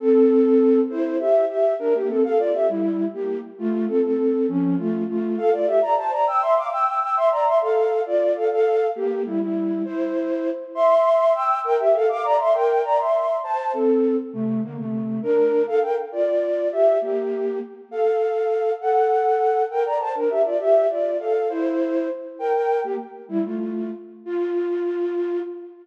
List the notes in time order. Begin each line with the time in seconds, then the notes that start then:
0.00 C4 A4
0.90 E4 C5
1.19 G4 E5
1.49 G4 E5
1.79 D4 A#4
1.94 A#3 G4
2.09 C4 A4
2.24 A4 F5
2.39 F4 D5
2.54 G4 E5
2.69 G3 E4
3.13 A#3 G4
3.58 A3 F4
3.88 C4 A4
4.03 C4 A4
4.48 F3 C#4
4.78 A3 F4
5.08 A3 F4
5.37 A4 F5
5.52 F4 D5
5.67 G4 E5
5.82 D5 A#5
5.97 C5 A5
6.12 D5 A#5
6.27 G5 E6
6.42 E5 C6
6.57 F5 D6
6.72 G5 E6
6.87 G5 E6
7.01 G5 E6
7.16 E5 C6
7.31 D5 A#5
7.46 E5 C6
7.61 A4 F5
8.06 F4 D5
8.36 A4 F5
8.51 A4 F5
8.95 A#3 G4
9.25 G3 E4
9.40 G3 E4
9.85 E4 C5
10.75 E5 C6
11.34 G5 E6
11.64 A#4 G5
11.79 G4 E5
11.94 A4 F5
12.09 F5 D6
12.24 D5 A#5
12.39 E5 C6
12.54 A#4 G5
12.84 D5 A#5
12.98 E5 C6
13.43 C5 A5
13.73 C4 A4
14.33 C3 A3
14.63 D3 A#3
14.78 C3 A3
15.22 D4 A#4
15.67 A4 F5
15.82 A#4 G5
16.12 F4 D5
16.72 G4 E5
17.01 A#3 G4
17.91 A4 F5
18.81 A4 F#5
19.70 A#4 G5
19.85 D5 A#5
20.00 C5 A5
20.15 D4 A#4
20.30 G4 E5
20.45 F4 D5
20.60 G4 E5
20.90 F4 D5
21.19 A4 F5
21.49 E4 C5
22.39 A#4 G5
22.54 A#4 G5
22.84 A#3 G4
23.28 G3 E4
23.44 A3 F4
24.25 F4